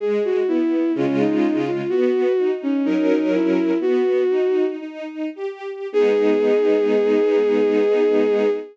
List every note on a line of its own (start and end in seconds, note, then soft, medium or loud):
0.00 0.43 G#3 loud
0.00 0.23 G#4 medium
0.25 0.47 F#4 medium
0.47 0.90 B3 medium
0.47 0.92 E4 medium
0.95 1.81 C#3 medium
0.95 1.81 G#3 loud
0.95 1.18 C#4 medium
0.95 1.81 F4 loud
1.20 1.59 D#4 medium
1.66 1.89 F4 medium
1.89 2.33 B3 loud
1.89 2.51 F#4 medium
2.38 2.81 D#4 medium
2.63 2.85 C#4 medium
2.84 3.71 F#3 loud
2.84 3.71 C#4 medium
2.84 3.07 D#4 medium
2.84 3.71 A#4 loud
3.10 3.32 D#4 medium
3.34 3.78 E4 medium
3.81 4.24 B3 medium
3.81 4.65 F#4 medium
4.30 4.76 D#4 medium
4.81 5.30 D#4 medium
5.35 5.87 G4 medium
5.93 8.49 G#3 loud
5.93 8.49 B3 loud
5.93 8.49 D#4 loud
5.93 8.50 G#4 loud